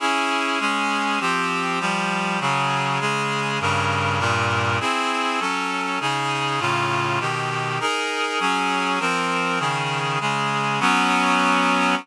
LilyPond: \new Staff { \time 6/8 \key ees \major \tempo 4. = 100 <des' fes' aes'>4. <aes des' aes'>4. | <f c' g'>4. <f g g'>4. | <des ges aes'>4. <des aes aes'>4. | <g, des bes'>4. <g, bes, bes'>4. |
\key bes \major <c' e' gis'>4. <ges des' a'>4. | <des ees' aes'>4. <a, cis eis'>4. | <ces ees g'>4. <ees' aes' bes'>4. | <ges des' aes'>4. <f c' bes'>4. |
\key ees \major <des ees aes'>4. <des aes aes'>4. | <ges ces' des'>2. | }